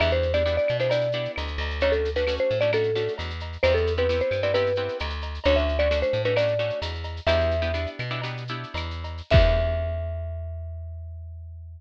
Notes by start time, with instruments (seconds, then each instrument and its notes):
0.00 electric bass (finger) E2, acoustic guitar (steel) B3 D4 E4 G4, marimba E5, cowbell, claves, shaker
0.11 marimba C5, shaker
0.22 shaker
0.34 acoustic guitar (steel) B3 D4 E4 G4, marimba D5, shaker
0.46 acoustic guitar (steel) B3 D4 E4 G4, shaker
0.57 marimba D5, shaker
0.68 electric bass (finger) B2, claves, shaker
0.80 acoustic guitar (steel) B3 D4 E4 G4, marimba C5, shaker
0.90 acoustic guitar (steel) B3 D4 E4 G4, marimba D5, cowbell, shaker
1.01 shaker
1.12 acoustic guitar (steel) B3 D4 E4 G4, shaker
1.25 shaker
1.36 electric bass (finger) D2, cowbell, claves, shaker
1.47 shaker
1.58 electric bass (finger) D2, cowbell, shaker
1.70 shaker
1.80 acoustic guitar (steel) A3 C#4 D4 F#4, marimba C#5, cowbell, shaker
1.92 marimba A4, shaker
2.05 shaker
2.16 acoustic guitar (steel) A3 C#4 D4 F#4, marimba B4, shaker
2.27 acoustic guitar (steel) A3 C#4 D4 F#4, claves, shaker
2.37 marimba C5, shaker
2.50 electric bass (finger) A2, shaker
2.61 acoustic guitar (steel) A3 C#4 D4 F#4, marimba D5, shaker
2.73 acoustic guitar (steel) A3 C#4 D4 F#4, marimba A4, cowbell, claves, shaker
2.83 shaker
2.95 acoustic guitar (steel) A3 C#4 D4 F#4, shaker
3.08 shaker
3.18 electric bass (finger) E2, cowbell, shaker
3.30 shaker
3.40 cowbell, shaker
3.53 shaker
3.63 electric bass (finger) E2, acoustic guitar (steel) B3 C4 E4 G4, marimba C5, cowbell, claves, shaker
3.74 marimba A4, shaker
3.87 shaker
3.97 acoustic guitar (steel) B3 C4 E4 G4, marimba B4, shaker
4.09 acoustic guitar (steel) B3 C4 E4 G4, shaker
4.20 marimba C5, shaker
4.31 electric bass (finger) G2, claves, shaker
4.43 acoustic guitar (steel) B3 C4 E4 G4, marimba D5, shaker
4.54 acoustic guitar (steel) B3 C4 E4 G4, marimba B4, cowbell, shaker
4.66 shaker
4.75 acoustic guitar (steel) B3 C4 E4 G4, shaker
4.88 shaker
4.99 electric bass (finger) D2, cowbell, claves, shaker
5.10 shaker
5.22 cowbell, shaker
5.34 shaker
5.44 electric bass (finger) D2, acoustic guitar (steel) A3 C#4 D4 F#4, marimba C#5, cowbell, shaker
5.56 marimba E5, shaker
5.69 shaker
5.79 acoustic guitar (steel) A3 C#4 D4 F#4, marimba D5, shaker
5.91 acoustic guitar (steel) A3 C#4 D4 F#4, claves, shaker
6.02 marimba C5, shaker
6.13 electric bass (finger) A2, shaker
6.25 acoustic guitar (steel) A3 C#4 D4 F#4, marimba B4, shaker
6.36 acoustic guitar (steel) A3 C#4 D4 F#4, marimba D5, cowbell, claves, shaker
6.48 shaker
6.59 acoustic guitar (steel) A3 C#4 D4 F#4, shaker
6.70 shaker
6.82 electric bass (finger) E2, cowbell, shaker
6.95 shaker
7.04 cowbell, shaker
7.17 shaker
7.27 electric bass (finger) E2, acoustic guitar (steel) B3 D4 E4 G4, marimba E5, cowbell, claves, shaker
7.40 shaker
7.51 shaker
7.62 acoustic guitar (steel) B3 D4 E4 G4, shaker
7.74 acoustic guitar (steel) B3 D4 E4 G4, shaker
7.86 shaker
7.99 electric bass (finger) B2, claves, shaker
8.10 acoustic guitar (steel) B3 D4 E4 G4, shaker
8.22 acoustic guitar (steel) B3 D4 E4 G4, cowbell, shaker
8.37 shaker
8.48 acoustic guitar (steel) B3 D4 E4 G4, shaker
8.63 shaker
8.74 electric bass (finger) E2, cowbell, claves, shaker
8.91 shaker
9.04 cowbell, shaker
9.18 shaker
9.30 electric bass (finger) E2, acoustic guitar (steel) B3 D4 E4 G4, marimba E5, kick, crash